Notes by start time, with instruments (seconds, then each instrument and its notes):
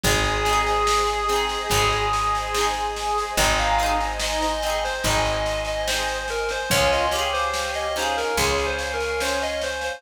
0.04 electric bass (finger) G#1, orchestral harp C4, clarinet G#4, pad 2 (warm) C5 D#5 G#5, kick, snare
0.08 orchestral harp D#4 G#4
0.24 snare
0.45 orchestral harp C4, snare
0.49 orchestral harp D#4 G#4
0.66 snare
0.87 snare
1.07 snare
1.29 orchestral harp C4 D#4, snare
1.36 orchestral harp G#4
1.49 snare
1.70 electric bass (finger) G#1, orchestral harp C4, kick, snare
1.74 orchestral harp D#4 G#4
1.92 snare
2.13 snare
2.35 snare
2.55 orchestral harp C4 D#4, snare
2.61 orchestral harp G#4
2.74 snare
2.97 snare
3.18 snare
3.37 electric bass (finger) G#1, orchestral harp C4 D#4, clarinet D#4 D#5, pad 2 (warm) C5 D#5 G#5, kick, snare
3.44 orchestral harp G#4
3.58 clarinet F5, snare
3.78 orchestral harp C4, snare
3.83 orchestral harp D#4 G#4
4.01 snare
4.20 clarinet D#5, snare
4.41 clarinet D#5, snare
4.62 orchestral harp C4, clarinet D#5, snare
4.66 orchestral harp D#4 G#4
4.84 clarinet C5, snare
5.04 electric bass (finger) G#1, orchestral harp C4 D#4, clarinet D#5, kick, snare
5.11 orchestral harp G#4
5.25 snare
5.46 snare
5.65 clarinet D#5, snare
5.87 orchestral harp C4 D#4, clarinet C5, snare
5.94 orchestral harp G#4
6.08 snare
6.28 clarinet A#4, snare
6.49 clarinet C5, snare
6.70 electric bass (finger) C#2, orchestral harp C#4, clarinet F4 C#5, pad 2 (warm) C#5 F5 G#5, kick, snare
6.74 orchestral harp F4 G#4
6.92 clarinet D#5, snare
7.11 orchestral harp C#4, clarinet G4, snare
7.16 orchestral harp F4 G#4
7.33 clarinet C5, snare
7.54 snare
7.74 clarinet D#5, snare
7.96 orchestral harp C#4 F4, clarinet D#4 C5, snare
8.02 orchestral harp G#4
8.17 clarinet A#4, snare
8.37 electric bass (finger) C#2, orchestral harp C#4 F4, clarinet G#4, kick, snare
8.44 orchestral harp G#4
8.58 snare
8.66 clarinet C5
8.79 snare
8.93 clarinet A#4
9.01 snare
9.20 orchestral harp C#4, clarinet C5, snare
9.25 orchestral harp F4 G#4
9.42 clarinet D#5, snare
9.61 clarinet C5, snare
9.81 clarinet C5, snare